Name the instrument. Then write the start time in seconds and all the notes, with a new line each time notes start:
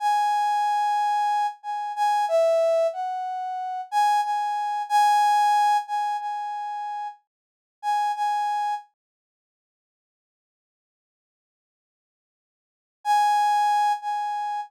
brass section
0.00 G#5
1.63 G#5
1.96 G#5
2.28 E5
2.93 F#5
3.91 G#5
4.24 G#5
4.89 G#5
5.87 G#5
6.20 G#5
7.82 G#5
8.16 G#5
13.04 G#5
14.02 G#5